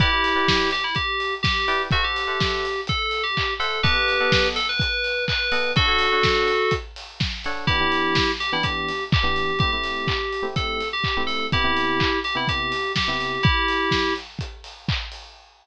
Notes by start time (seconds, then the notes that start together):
0.00 E4 G4 B4 D5 G5, kick, closed hi-hat
0.12 E4 B4 D5 G5
0.24 open hi-hat
0.35 E4 B4 D5 G5
0.48 kick, snare
0.71 G4, open hi-hat
0.84 E4
0.95 G4, kick, closed hi-hat
1.20 open hi-hat
1.43 G4, kick, snare
1.68 E4 B4 D5 G5, open hi-hat
1.91 F#4 A4 C5 E5 F#5, kick, closed hi-hat
2.03 G4 A4 C5 E5 F#5
2.16 open hi-hat
2.27 A4 C5 E5 F#5
2.40 kick, snare
2.65 open hi-hat
2.87 A4, kick, closed hi-hat
3.11 open hi-hat
3.23 G4
3.37 kick, clap
3.60 A4 C5 E5 F#5, open hi-hat
3.83 B3 G4 A4 B4 D#5 F#5, kick, closed hi-hat
3.95 B3 A4 D#5 F#5
4.08 open hi-hat
4.20 B3 A4 D#5 F#5
4.32 kick, snare
4.56 A4, open hi-hat
4.69 B4
4.79 B4, kick, closed hi-hat
5.04 open hi-hat
5.28 B4, kick, clap
5.52 B3 A4 D#5 F#5, open hi-hat
5.76 D4 F#4 A4 C#5 F#5, kick, closed hi-hat
5.88 D4 A4 C#5 F#5
5.99 open hi-hat
6.12 D4 A4 C#5 F#5
6.23 kick, snare
6.48 open hi-hat
6.71 kick, closed hi-hat
6.96 open hi-hat
7.20 kick, snare
7.44 D4 A4 C#5 F#5, open hi-hat
7.67 E3 B3 D4 E4 G4, kick, closed hi-hat
7.80 E3 B3 D4 G4
7.92 open hi-hat
8.15 kick, snare
8.40 G4, open hi-hat
8.52 E3 B3 D4 E4 G4
8.63 G4, kick, closed hi-hat
8.88 open hi-hat
9.12 G4, kick, clap
9.23 E3 B3 D4 G4
9.36 open hi-hat
9.59 A3 C4 E4 G4, kick, closed hi-hat
9.72 A3 C4 E4 G4
9.84 open hi-hat
10.08 kick, clap
10.33 open hi-hat
10.43 A3 C4 E4 G4
10.56 A4, kick, closed hi-hat
10.80 open hi-hat
10.93 G4
11.04 kick, clap
11.17 A3 C4 E4 G4
11.27 A4, open hi-hat
11.52 C3 B3 E4 G4, kick, closed hi-hat
11.64 C3 B3 E4 G4
11.77 open hi-hat
12.00 kick, clap
12.24 G4, open hi-hat
12.35 C3 B3 E4 G4
12.48 G4, kick, closed hi-hat
12.72 open hi-hat
12.96 G4, kick, snare
13.08 C3 B3 E4 G4
13.20 open hi-hat
13.43 E4 G4, kick, closed hi-hat
13.68 open hi-hat
13.91 kick, snare
14.16 open hi-hat
14.39 kick, closed hi-hat
14.64 open hi-hat
14.88 kick, clap
15.12 open hi-hat